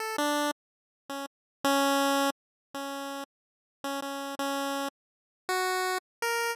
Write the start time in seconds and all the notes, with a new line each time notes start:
0.00 A4
0.18 D4
1.09 C#4
1.64 C#4
2.74 C#4
3.84 C#4
4.02 C#4
4.39 C#4
5.49 F#4
6.22 A#4